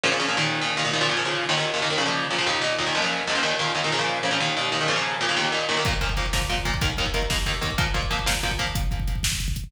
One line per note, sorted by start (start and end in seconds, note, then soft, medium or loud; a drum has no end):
0.03 0.10 A#2 medium
0.03 0.10 C#3 medium
0.03 0.10 F3 medium
0.12 0.18 A#2 medium
0.12 0.18 C#3 medium
0.12 0.18 F3 medium
0.20 0.26 A#2 medium
0.20 0.26 C#3 medium
0.20 0.26 F3 medium
0.28 0.36 A#2 medium
0.28 0.36 C#3 medium
0.28 0.36 F3 medium
0.37 0.60 D#2 medium
0.37 0.60 A#2 medium
0.37 0.60 D#3 medium
0.61 0.74 D#2 medium
0.61 0.74 A#2 medium
0.61 0.74 D#3 medium
0.77 0.83 D#2 medium
0.77 0.83 A#2 medium
0.77 0.83 D#3 medium
0.85 0.91 D#2 medium
0.85 0.91 A#2 medium
0.85 0.91 D#3 medium
0.93 1.00 D#2 medium
0.93 1.00 A#2 medium
0.93 1.00 D#3 medium
1.01 1.07 A#2 loud
1.01 1.07 C#3 medium
1.01 1.07 F3 medium
1.09 1.16 A#2 medium
1.09 1.16 C#3 medium
1.09 1.16 F3 medium
1.17 1.23 A#2 medium
1.17 1.23 C#3 medium
1.17 1.23 F3 medium
1.25 1.45 A#2 medium
1.25 1.45 C#3 medium
1.25 1.45 F3 medium
1.49 1.55 D#2 medium
1.49 1.55 A#2 medium
1.49 1.55 D#3 medium
1.57 1.70 D#2 medium
1.57 1.70 A#2 medium
1.57 1.70 D#3 medium
1.74 1.80 D#2 medium
1.74 1.80 A#2 medium
1.74 1.80 D#3 medium
1.82 1.89 D#2 medium
1.82 1.89 A#2 medium
1.82 1.89 D#3 medium
1.90 1.97 D#2 medium
1.90 1.97 A#2 medium
1.90 1.97 D#3 medium
1.98 2.04 A#2 medium
1.98 2.04 C#3 medium
1.98 2.04 F3 medium
2.06 2.25 A#2 medium
2.06 2.25 C#3 medium
2.06 2.25 F3 medium
2.31 2.37 A#2 medium
2.31 2.37 C#3 medium
2.31 2.37 F3 medium
2.38 2.45 A#2 medium
2.38 2.45 C#3 medium
2.38 2.45 F3 medium
2.47 2.59 D#2 medium
2.47 2.59 A#2 medium
2.47 2.59 D#3 medium
2.61 2.74 D#2 medium
2.61 2.74 A#2 medium
2.61 2.74 D#3 medium
2.78 2.85 D#2 medium
2.78 2.85 A#2 medium
2.78 2.85 D#3 medium
2.86 2.93 D#2 medium
2.86 2.93 A#2 medium
2.86 2.93 D#3 medium
2.95 3.01 C#2 medium
2.95 3.01 A#2 medium
2.95 3.01 F3 medium
3.02 3.21 C#2 medium
3.02 3.21 A#2 medium
3.02 3.21 F3 medium
3.27 3.34 C#2 medium
3.27 3.34 A#2 medium
3.27 3.34 F3 medium
3.35 3.41 C#2 medium
3.35 3.41 A#2 medium
3.35 3.41 F3 medium
3.43 3.56 D#2 medium
3.43 3.56 A#2 medium
3.43 3.56 D#3 medium
3.59 3.72 D#2 medium
3.59 3.72 A#2 medium
3.59 3.72 D#3 medium
3.75 3.81 D#2 medium
3.75 3.81 A#2 medium
3.75 3.81 D#3 medium
3.84 3.91 D#2 medium
3.84 3.91 A#2 medium
3.84 3.91 D#3 medium
3.92 3.98 A#2 medium
3.92 3.98 C#3 medium
3.92 3.98 F3 medium
3.99 4.18 A#2 medium
3.99 4.18 C#3 medium
3.99 4.18 F3 medium
4.23 4.30 A#2 medium
4.23 4.30 C#3 medium
4.23 4.30 F3 medium
4.31 4.37 A#2 medium
4.31 4.37 C#3 medium
4.31 4.37 F3 medium
4.40 4.53 D#2 medium
4.40 4.53 A#2 medium
4.40 4.53 D#3 medium
4.57 4.70 D#2 medium
4.57 4.70 A#2 medium
4.57 4.70 D#3 medium
4.72 4.78 D#2 medium
4.72 4.78 A#2 medium
4.72 4.78 D#3 medium
4.81 4.87 D#2 medium
4.81 4.87 A#2 medium
4.81 4.87 D#3 medium
4.88 4.94 A#2 medium
4.88 4.94 C#3 medium
4.88 4.94 F3 medium
4.96 5.15 A#2 medium
4.96 5.15 C#3 medium
4.96 5.15 F3 medium
5.21 5.27 A#2 medium
5.21 5.27 C#3 medium
5.21 5.27 F3 medium
5.29 5.35 A#2 medium
5.29 5.35 C#3 medium
5.29 5.35 F3 medium
5.37 5.49 D#2 medium
5.37 5.49 A#2 medium
5.37 5.49 D#3 medium
5.52 5.65 D#2 medium
5.52 5.65 A#2 medium
5.52 5.65 D#3 medium
5.69 5.75 D#2 medium
5.69 5.75 A#2 medium
5.69 5.75 D#3 medium
5.77 5.83 D#2 medium
5.77 5.83 A#2 medium
5.77 5.83 D#3 medium
5.85 5.92 A#2 medium
5.85 5.92 F3 medium
5.85 5.92 A#3 medium
5.85 kick loud
5.85 closed hi-hat loud
5.93 kick medium
6.01 6.08 A#2 medium
6.01 6.08 F3 medium
6.01 6.08 A#3 medium
6.01 kick medium
6.01 closed hi-hat medium
6.09 kick medium
6.17 6.24 A#2 medium
6.17 6.24 F3 medium
6.17 6.24 A#3 medium
6.17 kick medium
6.17 closed hi-hat medium
6.26 kick medium
6.33 6.40 A#2 medium
6.33 6.40 F3 medium
6.33 6.40 A#3 medium
6.33 kick medium
6.33 snare loud
6.42 kick medium
6.49 6.56 A#2 medium
6.49 6.56 F3 medium
6.49 6.56 A#3 medium
6.49 kick medium
6.49 closed hi-hat medium
6.57 kick medium
6.65 6.72 A#2 medium
6.65 6.72 F3 medium
6.65 6.72 A#3 medium
6.65 kick medium
6.65 closed hi-hat medium
6.74 kick medium
6.81 6.88 D#2 medium
6.81 6.88 D#3 medium
6.81 6.88 A#3 medium
6.81 kick loud
6.81 closed hi-hat loud
6.90 kick medium
6.97 7.05 D#2 medium
6.97 7.05 D#3 medium
6.97 7.05 A#3 medium
6.97 kick medium
6.97 closed hi-hat medium
7.06 kick medium
7.14 7.20 D#2 medium
7.14 7.20 D#3 medium
7.14 7.20 A#3 medium
7.14 kick medium
7.14 closed hi-hat medium
7.22 kick medium
7.30 7.36 D#2 medium
7.30 7.36 D#3 medium
7.30 7.36 A#3 medium
7.30 kick loud
7.30 snare loud
7.39 kick medium
7.46 7.53 D#2 medium
7.46 7.53 D#3 medium
7.46 7.53 A#3 medium
7.46 kick medium
7.46 closed hi-hat medium
7.54 kick medium
7.61 7.68 D#2 medium
7.61 7.68 D#3 medium
7.61 7.68 A#3 medium
7.61 kick medium
7.61 closed hi-hat medium
7.70 kick medium
7.78 7.84 A#2 medium
7.78 7.84 F3 medium
7.78 7.84 A#3 medium
7.78 kick loud
7.78 closed hi-hat loud
7.87 kick medium
7.94 8.01 A#2 medium
7.94 8.01 F3 medium
7.94 8.01 A#3 medium
7.94 kick medium
7.94 closed hi-hat medium
8.03 kick medium
8.11 8.17 A#2 medium
8.11 8.17 F3 medium
8.11 8.17 A#3 medium
8.11 kick medium
8.11 closed hi-hat medium
8.19 kick medium
8.26 8.33 A#2 medium
8.26 8.33 F3 medium
8.26 8.33 A#3 medium
8.26 kick medium
8.26 snare loud
8.35 kick medium
8.43 8.50 A#2 medium
8.43 8.50 F3 medium
8.43 8.50 A#3 medium
8.43 kick medium
8.43 closed hi-hat medium
8.51 kick medium
8.59 8.65 A#2 medium
8.59 8.65 F3 medium
8.59 8.65 A#3 medium
8.59 kick medium
8.59 closed hi-hat medium
8.67 kick medium
8.75 kick loud
8.75 closed hi-hat loud
8.83 kick medium
8.91 kick medium
8.91 closed hi-hat medium
9.00 kick medium
9.08 kick medium
9.08 closed hi-hat medium
9.16 kick medium
9.23 kick medium
9.23 snare loud
9.32 kick medium
9.40 kick medium
9.40 closed hi-hat medium
9.48 kick medium
9.56 kick medium
9.56 closed hi-hat medium
9.64 kick medium